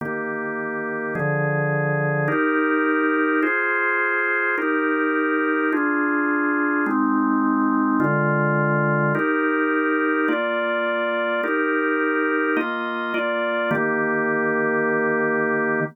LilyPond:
\new Staff { \time 4/4 \key ees \major \tempo 4 = 105 <ees bes g'>2 <d f aes'>2 | <ees' g' bes'>2 <f' aes' c''>2 | <ees' g' bes'>2 <d' f' aes'>2 | <aes c' ees'>2 <d aes f'>2 |
<ees' g' bes'>2 <bes f' d''>2 | <ees' g' bes'>2 <bes f' ees''>4 <bes f' d''>4 | <ees bes g'>1 | }